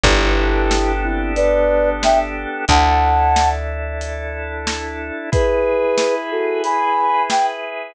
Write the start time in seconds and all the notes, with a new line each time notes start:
0.03 G1 B3 D4 E4 G4 A4, kick, closed hi-hat
0.71 snare
1.04 C4 E4
1.36 B4 D5, closed hi-hat
2.03 E5 G5, snare
2.68 D2 D4 E4 A4 F#5 A5, kick, closed hi-hat
3.36 snare
4.01 closed hi-hat
4.67 snare
5.32 E4 G#4 B4, kick, closed hi-hat
5.98 snare
6.31 F#4 A4
6.64 G#5 B5, closed hi-hat
7.30 G5, snare